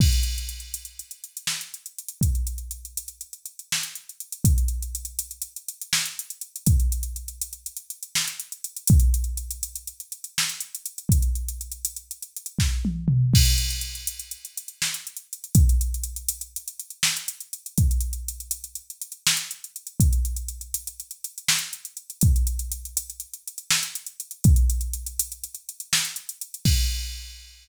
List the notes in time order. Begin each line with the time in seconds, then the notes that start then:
0.00 kick, crash
0.13 closed hi-hat
0.23 closed hi-hat
0.38 closed hi-hat
0.49 closed hi-hat
0.60 closed hi-hat
0.74 closed hi-hat
0.85 closed hi-hat
0.99 closed hi-hat
1.11 closed hi-hat
1.24 closed hi-hat
1.37 closed hi-hat
1.47 snare
1.61 closed hi-hat
1.74 closed hi-hat
1.86 closed hi-hat
1.99 closed hi-hat
2.08 closed hi-hat
2.21 kick, closed hi-hat
2.35 closed hi-hat
2.47 closed hi-hat
2.58 closed hi-hat
2.71 closed hi-hat
2.85 closed hi-hat
2.97 closed hi-hat
3.08 closed hi-hat
3.21 closed hi-hat
3.33 closed hi-hat
3.46 closed hi-hat
3.59 closed hi-hat
3.72 snare
3.83 closed hi-hat
3.95 closed hi-hat
4.09 closed hi-hat
4.20 closed hi-hat
4.32 closed hi-hat
4.44 kick, closed hi-hat
4.58 closed hi-hat
4.68 closed hi-hat
4.82 closed hi-hat
4.95 closed hi-hat
5.05 closed hi-hat
5.19 closed hi-hat
5.31 closed hi-hat
5.42 closed hi-hat
5.56 closed hi-hat
5.68 closed hi-hat
5.81 closed hi-hat
5.93 snare
6.06 closed hi-hat
6.19 closed hi-hat
6.30 closed hi-hat
6.41 closed hi-hat
6.56 closed hi-hat
6.66 kick, closed hi-hat
6.80 closed hi-hat
6.92 closed hi-hat
7.03 closed hi-hat
7.16 closed hi-hat
7.28 closed hi-hat
7.41 closed hi-hat
7.53 closed hi-hat
7.66 closed hi-hat
7.77 closed hi-hat
7.90 closed hi-hat
8.03 closed hi-hat
8.15 snare
8.28 closed hi-hat
8.40 closed hi-hat
8.52 closed hi-hat
8.64 closed hi-hat
8.76 closed hi-hat
8.87 kick, closed hi-hat
9.00 closed hi-hat
9.14 closed hi-hat
9.24 closed hi-hat
9.37 closed hi-hat
9.51 closed hi-hat
9.63 closed hi-hat
9.76 closed hi-hat
9.87 closed hi-hat
10.00 closed hi-hat
10.12 closed hi-hat
10.24 closed hi-hat
10.38 snare
10.49 closed hi-hat
10.60 closed hi-hat
10.75 closed hi-hat
10.86 closed hi-hat
10.98 closed hi-hat
11.09 kick, closed hi-hat
11.22 closed hi-hat
11.35 closed hi-hat
11.48 closed hi-hat
11.61 closed hi-hat
11.72 closed hi-hat
11.85 closed hi-hat
11.96 closed hi-hat
12.11 closed hi-hat
12.22 closed hi-hat
12.37 closed hi-hat
12.46 closed hi-hat
12.59 kick, snare
12.85 high tom
13.08 mid tom
13.34 kick, crash
13.45 closed hi-hat
13.58 closed hi-hat
13.70 closed hi-hat
13.81 closed hi-hat
13.95 closed hi-hat
14.07 closed hi-hat
14.19 closed hi-hat
14.31 closed hi-hat
14.45 closed hi-hat
14.57 closed hi-hat
14.68 closed hi-hat
14.82 snare
14.94 closed hi-hat
15.07 closed hi-hat
15.17 closed hi-hat
15.33 closed hi-hat
15.44 closed hi-hat
15.55 kick, closed hi-hat
15.69 closed hi-hat
15.81 closed hi-hat
15.94 closed hi-hat
16.03 closed hi-hat
16.16 closed hi-hat
16.28 closed hi-hat
16.41 closed hi-hat
16.56 closed hi-hat
16.68 closed hi-hat
16.80 closed hi-hat
16.90 closed hi-hat
17.03 snare
17.17 closed hi-hat
17.28 closed hi-hat
17.40 closed hi-hat
17.53 closed hi-hat
17.66 closed hi-hat
17.78 kick, closed hi-hat
17.91 closed hi-hat
18.01 closed hi-hat
18.13 closed hi-hat
18.28 closed hi-hat
18.40 closed hi-hat
18.51 closed hi-hat
18.64 closed hi-hat
18.75 closed hi-hat
18.90 closed hi-hat
19.02 closed hi-hat
19.12 closed hi-hat
19.27 snare
19.37 closed hi-hat
19.51 closed hi-hat
19.64 closed hi-hat
19.76 closed hi-hat
19.87 closed hi-hat
20.00 kick, closed hi-hat
20.13 closed hi-hat
20.25 closed hi-hat
20.36 closed hi-hat
20.48 closed hi-hat
20.61 closed hi-hat
20.74 closed hi-hat
20.87 closed hi-hat
21.00 closed hi-hat
21.11 closed hi-hat
21.24 closed hi-hat
21.38 closed hi-hat
21.48 snare
21.59 closed hi-hat
21.73 closed hi-hat
21.85 closed hi-hat
21.97 closed hi-hat
22.10 closed hi-hat
22.21 kick, closed hi-hat
22.36 closed hi-hat
22.47 closed hi-hat
22.59 closed hi-hat
22.72 closed hi-hat
22.85 closed hi-hat
22.97 closed hi-hat
23.10 closed hi-hat
23.20 closed hi-hat
23.34 closed hi-hat
23.47 closed hi-hat
23.58 closed hi-hat
23.70 snare
23.83 closed hi-hat
23.95 closed hi-hat
24.06 closed hi-hat
24.20 closed hi-hat
24.31 closed hi-hat
24.44 kick, closed hi-hat
24.56 closed hi-hat
24.70 closed hi-hat
24.81 closed hi-hat
24.93 closed hi-hat
25.06 closed hi-hat
25.19 closed hi-hat
25.32 closed hi-hat
25.44 closed hi-hat
25.55 closed hi-hat
25.69 closed hi-hat
25.80 closed hi-hat
25.93 snare
26.05 closed hi-hat
26.16 closed hi-hat
26.29 closed hi-hat
26.41 closed hi-hat
26.54 closed hi-hat
26.65 kick, crash